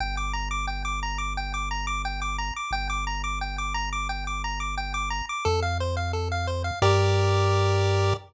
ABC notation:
X:1
M:4/4
L:1/8
Q:1/4=176
K:Gm
V:1 name="Lead 1 (square)"
g d' b d' g d' b d' | g d' b d' g d' b d' | g d' b d' g d' b d' | g d' b d' g d' b d' |
A f c f A f c f | [GBd]8 |]
V:2 name="Synth Bass 1" clef=bass
G,,,8- | G,,,8 | G,,,8- | G,,,8 |
F,,8 | G,,8 |]